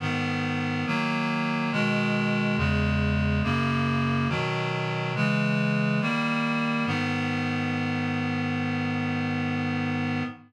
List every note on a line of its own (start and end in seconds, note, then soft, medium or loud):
0.00 0.85 G#2 medium
0.00 0.85 D#3 loud
0.00 0.85 B3 medium
0.86 1.71 D#3 medium
0.86 1.71 F#3 loud
0.86 1.71 A#3 medium
1.72 2.57 B2 medium
1.72 2.57 D#3 loud
1.72 2.57 G#3 loud
2.57 3.42 E2 loud
2.57 3.42 C#3 medium
2.57 3.42 G#3 medium
3.43 4.28 F#2 loud
3.43 4.28 C#3 medium
3.43 4.28 A#3 loud
4.29 5.14 B2 medium
4.29 5.14 D#3 loud
4.29 5.14 F#3 medium
5.15 6.00 C#3 medium
5.15 6.00 E3 medium
5.15 6.00 G#3 loud
6.01 6.86 D#3 medium
6.01 6.86 G3 loud
6.01 6.86 A#3 loud
6.86 10.23 G#2 medium
6.86 10.23 D#3 medium
6.86 10.23 B3 loud